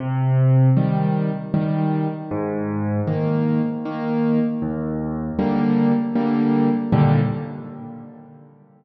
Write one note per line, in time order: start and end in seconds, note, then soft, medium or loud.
0.00 0.69 C3 medium
0.77 1.31 D#3 medium
0.77 1.31 G3 medium
1.54 2.08 D#3 medium
1.54 2.08 G3 medium
2.31 3.00 G#2 loud
3.07 3.61 D#3 medium
3.07 3.61 A#3 medium
3.85 4.39 D#3 medium
3.85 4.39 A#3 medium
4.62 5.31 D#2 loud
5.39 5.93 D3 medium
5.39 5.93 G3 medium
5.39 5.93 A#3 medium
6.16 6.69 D3 medium
6.16 6.69 G3 medium
6.16 6.69 A#3 medium
6.92 7.19 D#2 loud
6.92 7.19 A#2 medium
6.92 7.19 D3 loud
6.92 7.19 G3 medium